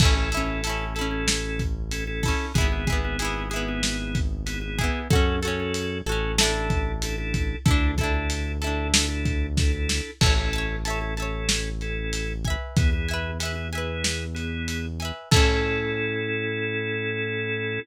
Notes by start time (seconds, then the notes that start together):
0.00 A1 C#4 E4 A4, kick, crash
0.05 C#4
0.16 C#4 E4 A4
0.32 E4 A4, closed hi-hat
0.37 C#4
0.46 C#4 E4 A4
0.64 E4 A4, closed hi-hat
0.70 C#4
0.95 C#4 E4 A4, closed hi-hat
1.01 C#4
1.11 C#4 E4 A4
1.28 snare
1.59 kick, closed hi-hat
1.91 C#4 E4 A4, closed hi-hat
2.07 C#4 E4 A4
2.23 E4 A4, kick, open hi-hat
2.28 C#4
2.54 G#1 B3 E4 G#4, kick, closed hi-hat
2.61 B3
2.72 B3 E4 G#4
2.87 E4 G#4, kick, closed hi-hat
2.92 B3
3.05 B3 E4 G#4
3.19 E4 G#4, closed hi-hat
3.25 B3
3.50 B3 E4 G#4, closed hi-hat
3.56 B3
3.68 B3 E4 G#4
3.83 snare
4.15 kick, closed hi-hat
4.46 B3 E4 G#4, closed hi-hat
4.61 B3 E4 G#4
4.78 E4 G#4, kick, closed hi-hat
4.84 B3
5.10 F#2 C#4 F#4 A4, kick, closed hi-hat
5.15 C#4
5.43 C#4 F#4 A4, closed hi-hat
5.48 C#4
5.60 C#4 F#4 A4
5.74 closed hi-hat
6.06 A1 C#4 F#4 A4, closed hi-hat
6.12 C#4
6.38 D4 E4 A4, snare
6.43 D4
6.54 D4 E4 A4
6.70 kick, closed hi-hat
7.02 D4 E4 A4, closed hi-hat
7.18 D4 E4 A4
7.34 kick, closed hi-hat
7.66 D2 D4 E4 A4, kick, closed hi-hat
7.71 D4
7.98 D4 E4 A4, kick, closed hi-hat
8.04 D4
8.14 D4 E4 A4
8.30 closed hi-hat
8.62 D4 E4 A4, closed hi-hat
8.67 D4
8.93 D4 E4 A4, snare
9.08 D4 E4 A4
9.25 kick, closed hi-hat
9.57 D4 E4 A4, kick, snare
9.73 D4 E4 A4
9.89 snare
10.21 A1 C#4 E4 A4 E5 A5, kick, crash
10.26 C#5
10.38 C#4 E4 A4
10.53 E5 A5, closed hi-hat
10.58 C#5
10.85 C#4 E4 A4 E5 A5, closed hi-hat
10.90 C#5
11.01 C#4 E4 A4
11.17 C#4 E4 A4 E5 A5, closed hi-hat
11.22 C#5
11.49 snare
11.81 C#4 E4 A4, closed hi-hat
12.13 closed hi-hat
12.45 E5 G#5, kick, closed hi-hat
12.50 B4
12.76 E2 B3 E4 G#4, kick, closed hi-hat
12.93 B3 E4 G#4
13.09 E5 G#5, closed hi-hat
13.14 B4
13.39 B3 E4 G#4 E5 G#5, closed hi-hat
13.45 B4
13.55 B3 E4 G#4
13.73 B3 E4 G#4 E5 G#5, closed hi-hat
13.78 B4
14.04 snare
14.35 B3 E4 G#4, closed hi-hat
14.68 closed hi-hat
15.00 E5 G#5, closed hi-hat
15.05 B4
15.31 A2 C#4 E4 A4, kick, crash
15.36 C#4